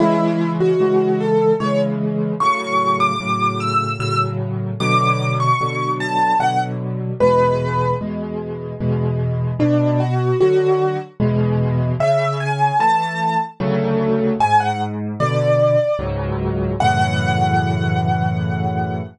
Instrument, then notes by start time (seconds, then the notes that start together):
acoustic grand piano
0.00 C#3 E3 G#3 E4
0.60 F#4
0.80 C#3 E3 G#3
1.20 A4
1.60 C#3 E3 G#3 C#5
2.40 A2 C#3 F#3 C#6
3.00 D6
3.20 A2 C#3 F#3
3.60 E6
3.99 A2 C#3 F#3 E6
4.80 B2 D3 F#3 D6
5.40 C#6
5.61 B2 D3 F#3
6.00 A5
6.39 B2 D3 F#3 F#5
7.20 E2 B2 G#3 B4
8.01 E2 B2 G#3
8.80 E2 B2 G#3
9.59 B2 D4
10.00 F#4
10.40 D3 F#3 F#4
11.20 E2 B2 G#3
12.00 C#3 E5
12.40 G#5
12.79 E3 A3 A5
13.60 D2 C#3 F#3 A3
14.40 G#2 G#5
14.60 F#5
15.20 B2 D3 D5
15.99 C#2 G#2 F#3
16.80 F#2 A2 C#3 E3 F#5